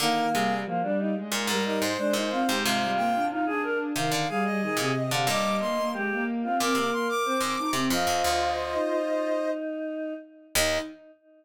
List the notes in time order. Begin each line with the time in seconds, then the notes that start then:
0.00 D3 D#3 A#3 A#4
0.32 C3 G3 G#4
0.48 G3
0.64 F3 A#3
0.81 G3 D4
0.99 D#4
1.16 G#3
1.32 A#2 G#3 A#4
1.47 G#2 G3 A#4
1.64 G3 D#4 A#4
1.82 G#2 C5
1.98 G#3 D4
2.13 A#2 G#3 D#4
2.31 C4 F4
2.47 G#2 G#3 G4
2.63 G#2 C3 G#3 F4 F5
2.80 G3
2.97 A#3 G5
3.14 D4
3.29 D#4 F4
3.46 D4 G#4
3.63 A#4
3.95 C3 D#3 F5
4.12 D3 F5
4.29 G3 G#4 F5
4.45 G3 D#5
4.61 D#3 G#4
4.77 A#2 C3 G#4
4.95 D#5
5.11 C3 D3 F5
5.25 G2 A#2 G3 D#5 D6
5.60 A#3 C6
5.77 A#3
5.93 G#3 G4
6.12 A#3
6.43 C4 F4
6.59 A#2 C4 A#4 D6
6.75 C3 A#3 D6
6.91 A#3 C6
7.09 D6
7.25 C4 C5
7.41 G#2 C4
7.58 D#4
7.73 C3 C4
7.90 F2 F4 C5 D#5
8.07 F2
8.24 D2
8.74 D#4
8.90 D#4
10.55 D#2 D#4 D#5